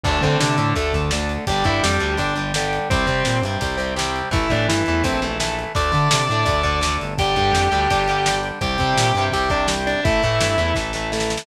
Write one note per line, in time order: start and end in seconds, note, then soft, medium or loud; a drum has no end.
0.04 0.19 D2 loud
0.04 0.21 D3 medium
0.04 0.21 A3 medium
0.04 1.33 D4 medium
0.04 0.19 D4 medium
0.04 1.33 A4 medium
0.04 0.19 D5 medium
0.04 kick loud
0.04 crash loud
0.21 0.36 D3 medium
0.21 0.56 D3 medium
0.21 0.56 A3 medium
0.21 0.37 C4 medium
0.21 0.37 C5 medium
0.21 kick medium
0.21 closed hi-hat medium
0.40 0.57 C3 loud
0.40 0.73 D3 medium
0.40 0.73 D4 medium
0.40 snare loud
0.58 0.74 A2 medium
0.58 0.74 D3 medium
0.58 0.74 A3 medium
0.58 closed hi-hat medium
0.75 1.37 D2 loud
0.75 0.92 D3 medium
0.75 0.92 A3 medium
0.75 0.92 A4 medium
0.75 kick medium
0.75 closed hi-hat loud
0.93 1.11 D3 medium
0.93 1.11 A3 medium
0.93 kick medium
0.93 closed hi-hat medium
1.11 1.45 D3 medium
1.11 1.45 A3 medium
1.11 snare loud
1.29 closed hi-hat medium
1.47 1.63 G1 loud
1.47 1.64 D3 medium
1.47 1.65 G3 medium
1.47 2.76 D4 medium
1.47 2.76 G4 medium
1.47 1.65 G4 medium
1.47 1.65 G5 medium
1.47 kick loud
1.47 closed hi-hat loud
1.64 1.80 G2 medium
1.64 1.97 D3 medium
1.64 1.97 G3 medium
1.64 1.79 E4 medium
1.64 1.79 E5 medium
1.64 kick medium
1.64 closed hi-hat medium
1.83 1.99 F2 medium
1.83 2.13 G3 medium
1.83 2.13 G4 medium
1.83 snare loud
2.00 2.16 D2 medium
2.00 2.17 D3 medium
2.00 2.17 G3 medium
2.00 closed hi-hat medium
2.17 2.79 G1 loud
2.17 2.34 D3 medium
2.17 2.34 G3 medium
2.17 2.33 D4 medium
2.17 2.33 D5 medium
2.17 kick medium
2.17 closed hi-hat loud
2.36 2.52 D3 medium
2.36 2.52 G3 medium
2.36 closed hi-hat medium
2.54 2.88 D3 medium
2.54 2.88 G3 medium
2.54 snare loud
2.73 closed hi-hat medium
2.90 3.05 C2 loud
2.90 3.06 C3 medium
2.90 3.07 G3 medium
2.90 4.19 C4 medium
2.90 3.36 C4 medium
2.90 4.19 G4 medium
2.90 3.36 C5 medium
2.90 kick loud
2.90 closed hi-hat loud
3.07 3.40 C3 medium
3.07 3.23 C3 medium
3.07 3.40 G3 medium
3.07 kick medium
3.07 closed hi-hat medium
3.25 3.42 A#2 medium
3.25 snare loud
3.42 3.57 G2 loud
3.42 3.60 C3 medium
3.42 3.61 G3 medium
3.42 closed hi-hat medium
3.61 4.22 C2 medium
3.61 3.77 C3 medium
3.61 3.77 G3 medium
3.61 kick medium
3.61 closed hi-hat loud
3.77 3.94 C3 medium
3.77 3.94 G3 medium
3.77 closed hi-hat medium
3.96 4.29 C3 medium
3.96 4.29 G3 medium
3.96 snare loud
4.16 closed hi-hat medium
4.31 4.46 A1 loud
4.31 4.48 E3 medium
4.31 4.48 A3 medium
4.31 5.61 E4 medium
4.31 4.50 E4 medium
4.31 5.61 A4 medium
4.31 4.50 E5 medium
4.31 kick loud
4.31 closed hi-hat loud
4.50 4.67 A2 medium
4.50 4.83 E3 medium
4.50 4.83 A3 medium
4.50 4.65 D4 medium
4.50 4.65 D5 medium
4.50 kick medium
4.50 closed hi-hat medium
4.68 4.83 G2 medium
4.68 5.00 E3 medium
4.68 5.00 E4 medium
4.68 snare loud
4.86 5.03 E2 medium
4.86 5.03 E3 medium
4.86 5.04 A3 medium
4.86 closed hi-hat medium
5.04 5.65 A#1 loud
5.04 5.20 E3 medium
5.04 5.20 A3 medium
5.04 5.20 C4 medium
5.04 5.20 C5 medium
5.04 kick medium
5.04 closed hi-hat loud
5.22 5.38 E3 medium
5.22 5.38 A3 medium
5.22 closed hi-hat medium
5.40 5.72 E3 medium
5.40 5.72 A3 medium
5.40 snare loud
5.59 closed hi-hat medium
5.75 5.92 D2 loud
5.75 5.91 D3 medium
5.75 5.91 A3 medium
5.75 7.05 D4 medium
5.75 7.05 A4 medium
5.75 6.92 D5 medium
5.75 6.92 D6 medium
5.75 kick loud
5.75 closed hi-hat loud
5.92 6.25 D3 medium
5.92 6.08 D3 medium
5.92 6.25 A3 medium
5.92 kick medium
5.92 closed hi-hat medium
6.11 6.28 C3 loud
6.11 snare loud
6.29 6.45 A2 loud
6.29 6.45 D3 medium
6.29 6.46 A3 medium
6.29 closed hi-hat medium
6.45 6.97 D2 loud
6.45 6.62 D3 medium
6.45 6.62 A3 medium
6.45 kick loud
6.45 closed hi-hat loud
6.63 6.80 D3 medium
6.63 6.80 A3 medium
6.63 kick medium
6.63 closed hi-hat medium
6.81 7.14 D3 medium
6.81 7.14 A3 medium
6.81 snare loud
7.01 7.35 G1 loud
7.01 closed hi-hat medium
7.18 7.36 D3 medium
7.18 7.36 G3 medium
7.18 8.48 D4 medium
7.18 8.33 G4 medium
7.18 8.48 G4 loud
7.18 8.33 G5 medium
7.18 kick loud
7.18 closed hi-hat loud
7.36 7.52 G2 loud
7.36 7.69 D3 medium
7.36 7.69 G3 medium
7.36 kick medium
7.36 closed hi-hat medium
7.53 7.68 F2 medium
7.53 snare loud
7.72 7.87 D2 medium
7.72 7.88 D3 medium
7.72 7.88 G3 medium
7.72 closed hi-hat medium
7.90 8.52 G1 medium
7.90 8.07 D3 medium
7.90 8.07 G3 medium
7.90 kick medium
7.90 closed hi-hat loud
8.08 8.25 D3 medium
8.08 8.25 G3 medium
8.08 closed hi-hat medium
8.26 8.59 D3 medium
8.26 8.59 G3 medium
8.26 snare loud
8.43 closed hi-hat medium
8.61 8.77 C2 loud
8.61 8.77 C3 medium
8.61 8.77 G3 medium
8.61 9.90 C4 medium
8.61 9.22 G4 medium
8.61 9.90 G4 medium
8.61 9.22 G5 medium
8.61 kick loud
8.61 closed hi-hat loud
8.78 8.94 C3 medium
8.78 9.13 C3 medium
8.78 9.13 G3 medium
8.78 kick medium
8.78 closed hi-hat medium
8.97 9.12 A#2 loud
8.97 snare loud
9.15 9.30 G2 loud
9.15 9.33 C3 medium
9.15 9.34 G3 medium
9.15 closed hi-hat medium
9.32 9.94 C2 loud
9.32 9.50 C3 medium
9.32 9.50 G3 medium
9.32 9.48 G4 medium
9.32 9.48 G5 medium
9.32 kick medium
9.32 closed hi-hat loud
9.50 9.66 C3 medium
9.50 9.66 G3 medium
9.50 9.66 D4 medium
9.50 9.66 D5 medium
9.50 kick medium
9.50 closed hi-hat medium
9.67 10.00 C3 medium
9.67 10.00 G3 medium
9.67 snare loud
9.87 10.04 D4 medium
9.87 10.04 D5 medium
9.87 closed hi-hat medium
10.03 10.20 A1 loud
10.03 10.22 E3 medium
10.03 10.22 A3 medium
10.03 11.32 E4 medium
10.03 10.69 E4 medium
10.03 11.32 A4 loud
10.03 10.69 E5 medium
10.03 kick loud
10.03 closed hi-hat loud
10.23 10.39 A2 medium
10.23 10.56 E3 medium
10.23 10.56 A3 medium
10.23 kick medium
10.23 closed hi-hat medium
10.41 10.57 G2 loud
10.41 snare loud
10.58 10.73 E2 loud
10.58 10.74 E3 medium
10.58 10.74 A3 medium
10.58 closed hi-hat medium
10.75 11.37 A1 loud
10.75 10.92 E3 medium
10.75 10.92 A3 medium
10.75 kick medium
10.75 snare medium
10.93 11.11 E3 medium
10.93 11.11 A3 medium
10.93 snare medium
11.12 11.45 E3 medium
11.12 11.45 A3 medium
11.12 snare medium
11.20 snare medium
11.30 snare medium
11.37 snare loud